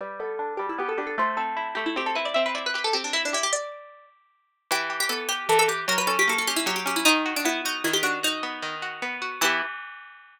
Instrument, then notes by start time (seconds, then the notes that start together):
pizzicato strings
0.01 G3 B4
0.20 B3 A4
0.39 D4
0.57 G3 G4
0.69 E4
0.78 B3 G4
0.89 A4
0.98 D4 G4
1.07 A4
1.18 A3 C5
1.37 C4 A4
1.57 E4
1.75 A3 G4
1.86 E4
1.96 C4 G4
2.06 A4
2.15 E4 B4
2.25 D5
2.34 C4 E5
2.46 B4
2.55 E4 D5
2.66 B4
2.74 G4 B4
2.84 A4
2.93 C4 G4
3.04 D4
3.13 E4
3.25 D4
3.33 E4 G4
3.43 G4
3.53 D5
4.71 E3 G4
4.90 G4
5.00 G4
5.09 B3 A4
5.29 G4
5.49 E3 A4
5.59 A4
5.68 G4
5.88 F#3 A#4
5.98 B4
6.07 C#4 A4
6.19 G4
6.28 A#3 A4
6.38 A4
6.47 C#4 G4
6.56 E4
6.66 F#3 G4
6.76 G4
6.86 C#4 G4
6.96 E4
7.05 D#3 D#4
7.26 F#4
7.36 D4
7.45 B3 E4
7.65 D#4 F#4
7.84 D#3 E4
7.93 G4
8.03 D4 F#4
8.23 D#4 F#4
8.43 B3
8.62 D#3
8.82 F#4
9.02 B3
9.22 F#4
9.41 E3 B3 E4 G4